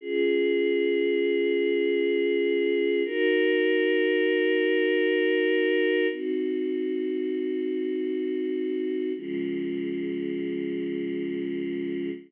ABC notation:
X:1
M:3/4
L:1/8
Q:1/4=59
K:Db
V:1 name="Choir Aahs"
[DFA]6 | [EGB]6 | [CEG]6 | [D,F,A,]6 |]